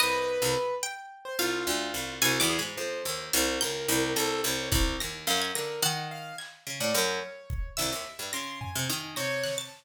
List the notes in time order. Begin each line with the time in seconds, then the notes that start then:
0.00 C2 B4 D#5
0.42 C2
0.83 G5
1.25 C5
1.39 C2 F4 F5
1.67 D2
1.94 C2
2.22 C2 F#4 G#5
2.40 E2 D6
2.50 G#4
2.59 G#2 B5
2.77 F2 C5
3.05 D#2, cowbell
3.33 C2 F6, closed hi-hat
3.61 C#2 A#4 G6
3.88 C2
4.16 C2 A4 A#6, closed hi-hat
4.44 C2 C#5
4.72 C2 F#6, kick
5.00 D#2 A#6
5.27 F#2 F5
5.42 G#6
5.55 D3 A#4 A#6, clap
5.82 D#3 F#5 F#6
6.11 F5
6.38 G#6, clap
6.67 C#3
6.80 A2 D5
6.94 F#2 C#5 F6
7.50 kick
7.77 C2 E5 E6, snare
7.92 D#2
8.19 G2
8.33 C#3 C6 A#6
8.61 G#5, floor tom
8.75 C3
8.90 D#3
9.16 C3 C#5 A#6
9.44 F#6, snare
9.58 A5 A6